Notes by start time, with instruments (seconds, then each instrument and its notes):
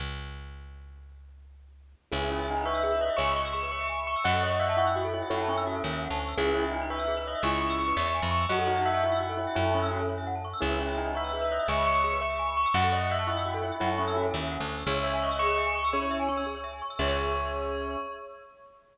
0.00 electric bass (finger) C#2
2.12 electric bass (finger) C#2, tubular bells C#4, acoustic grand piano E4 G#4, glockenspiel G#4
2.21 glockenspiel B4
2.30 tubular bells E4, glockenspiel C#5
2.39 glockenspiel E5
2.48 tubular bells D#4, glockenspiel G#5
2.56 glockenspiel B5
2.65 acoustic grand piano B4, tubular bells E5, glockenspiel C#6
2.74 glockenspiel E6
2.83 glockenspiel G#4
2.92 glockenspiel B4
3.01 glockenspiel C#5, tubular bells D#5
3.10 glockenspiel E5
3.16 electric bass (finger) C#2, acoustic grand piano C#5 E5, glockenspiel G#5, tubular bells C#6
3.27 glockenspiel B5
3.35 tubular bells C#6, glockenspiel C#6
3.45 glockenspiel E6
3.53 glockenspiel G#4, tubular bells C#6
3.63 glockenspiel B4
3.71 glockenspiel C#5, acoustic grand piano E5, tubular bells C#6
3.80 glockenspiel E5
3.89 glockenspiel G#5
3.98 glockenspiel B5
4.07 tubular bells C#6, glockenspiel C#6
4.16 glockenspiel E6
4.24 electric bass (finger) F#2, glockenspiel F#4, acoustic grand piano D#5 F#5, tubular bells F#5
4.34 glockenspiel A4
4.42 glockenspiel C#5, tubular bells D#5
4.51 glockenspiel E5
4.60 tubular bells E5, glockenspiel F#5
4.69 glockenspiel A5
4.77 tubular bells E4, acoustic grand piano F#5, glockenspiel C#6
4.87 glockenspiel E6
4.96 glockenspiel F#4
5.04 glockenspiel A4
5.13 tubular bells E4, glockenspiel C#5
5.22 glockenspiel E5
5.30 electric bass (finger) F#2, tubular bells E4, acoustic grand piano A4 C#5, glockenspiel F#5
5.40 glockenspiel A5
5.48 tubular bells C#4, glockenspiel C#6
5.57 glockenspiel E6
5.67 glockenspiel F#4
5.75 glockenspiel A4
5.84 electric bass (finger) D#2, glockenspiel C#5
5.93 glockenspiel E5
6.02 glockenspiel F#5
6.10 electric bass (finger) D2, glockenspiel A5
6.20 glockenspiel C#6
6.28 glockenspiel E6
6.37 electric bass (finger) C#2, tubular bells C#4, acoustic grand piano E4 G#4, glockenspiel G#4
6.46 glockenspiel B4
6.54 tubular bells E4, glockenspiel C#5
6.64 glockenspiel E5
6.71 tubular bells D#4, glockenspiel G#5
6.81 glockenspiel B5
6.90 acoustic grand piano B4, tubular bells E5, glockenspiel C#6
6.99 glockenspiel E6
7.08 glockenspiel G#4
7.17 glockenspiel B4
7.25 glockenspiel C#5, tubular bells D#5
7.35 glockenspiel E5
7.43 electric bass (finger) C#2, acoustic grand piano C#4 E4, glockenspiel G#5, tubular bells C#6
7.52 glockenspiel B5
7.61 tubular bells C#6, glockenspiel C#6
7.70 glockenspiel E6
7.78 glockenspiel G#4, tubular bells C#6
7.88 glockenspiel B4
7.97 electric bass (finger) E2, glockenspiel C#5, acoustic grand piano E5, tubular bells C#6
8.05 glockenspiel E5
8.14 glockenspiel G#5
8.22 electric bass (finger) F2, glockenspiel B5
8.31 tubular bells C#6, glockenspiel C#6
8.41 glockenspiel E6
8.49 electric bass (finger) F#2, glockenspiel F#4, tubular bells F#4, acoustic grand piano D#5 F#5
8.58 glockenspiel A4
8.67 tubular bells D#4, glockenspiel C#5
8.76 glockenspiel E5
8.85 tubular bells E5, glockenspiel F#5
8.94 glockenspiel A5
9.03 tubular bells E4, acoustic grand piano F#5, glockenspiel C#6
9.12 glockenspiel E6
9.20 glockenspiel F#4
9.29 glockenspiel A4
9.37 tubular bells E4, glockenspiel C#5
9.47 glockenspiel E5
9.55 electric bass (finger) F#2, tubular bells E4, acoustic grand piano A4 C#5, glockenspiel F#5
9.65 glockenspiel A5
9.74 tubular bells C#4, glockenspiel C#6
9.82 glockenspiel E6
9.91 glockenspiel F#4
10.00 glockenspiel A4
10.09 glockenspiel C#5
10.18 glockenspiel E5
10.27 glockenspiel F#5
10.35 glockenspiel A5
10.44 glockenspiel C#6
10.53 glockenspiel E6
10.61 electric bass (finger) C#2, tubular bells C#4, acoustic grand piano E4 G#4, glockenspiel G#4
10.71 glockenspiel B4
10.80 tubular bells E4, glockenspiel C#5
10.88 glockenspiel E5
10.97 tubular bells D#4, glockenspiel G#5
11.06 glockenspiel B5
11.14 acoustic grand piano B4, tubular bells E5, glockenspiel C#6
11.24 glockenspiel E6
11.33 glockenspiel G#4
11.41 glockenspiel B4
11.50 glockenspiel C#5, tubular bells D#5
11.59 glockenspiel E5
11.68 electric bass (finger) C#2, acoustic grand piano C#5 E5, glockenspiel G#5, tubular bells C#6
11.77 glockenspiel B5
11.86 glockenspiel C#6, tubular bells C#6
11.95 glockenspiel E6
12.04 glockenspiel G#4, tubular bells C#6
12.13 glockenspiel B4
12.21 glockenspiel C#5, acoustic grand piano E5, tubular bells C#6
12.30 glockenspiel E5
12.39 glockenspiel G#5
12.48 glockenspiel B5
12.56 glockenspiel C#6, tubular bells C#6
12.66 glockenspiel E6
12.74 electric bass (finger) F#2, glockenspiel F#4, acoustic grand piano D#5 F#5, tubular bells F#5
12.83 glockenspiel A4
12.92 glockenspiel C#5, tubular bells D#5
13.01 glockenspiel E5
13.10 tubular bells E5, glockenspiel F#5
13.19 glockenspiel A5
13.27 tubular bells E4, acoustic grand piano F#5, glockenspiel C#6
13.37 glockenspiel E6
13.45 glockenspiel F#4
13.54 glockenspiel A4
13.62 tubular bells E4, glockenspiel C#5
13.72 glockenspiel E5
13.80 electric bass (finger) F#2, tubular bells E4, acoustic grand piano A4 C#5, glockenspiel F#5
13.90 glockenspiel A5
13.98 tubular bells C#4, glockenspiel C#6
14.07 glockenspiel E6
14.16 glockenspiel F#4
14.25 glockenspiel A4
14.34 electric bass (finger) D#2, glockenspiel C#5
14.42 glockenspiel E5
14.51 glockenspiel F#5
14.60 electric bass (finger) D2, glockenspiel A5
14.69 glockenspiel C#6
14.78 glockenspiel E6
14.87 electric bass (finger) C#2, acoustic grand piano C#4 E4, glockenspiel G#4, tubular bells C#5
14.96 glockenspiel C#5
15.04 tubular bells E5, glockenspiel E5
15.13 glockenspiel G#5
15.22 tubular bells D#5, glockenspiel C#6
15.31 glockenspiel E6
15.39 glockenspiel G#4, acoustic grand piano G#4, tubular bells C#6
15.49 glockenspiel C#5
15.58 glockenspiel E5
15.66 glockenspiel G#5
15.75 tubular bells C#6, glockenspiel C#6
15.84 glockenspiel E6
15.93 acoustic grand piano C#4 E4, glockenspiel G#4, tubular bells C#5
16.02 glockenspiel C#5
16.11 glockenspiel E5
16.19 glockenspiel G#5
16.28 acoustic grand piano C#4, glockenspiel C#6
16.37 glockenspiel E6
16.46 glockenspiel G#4
16.55 glockenspiel C#5
16.64 glockenspiel E5
16.73 glockenspiel G#5
16.82 glockenspiel C#6
16.90 glockenspiel E6
16.99 electric bass (finger) C#2, acoustic grand piano C#4, glockenspiel G#4 C#5 E5, tubular bells C#5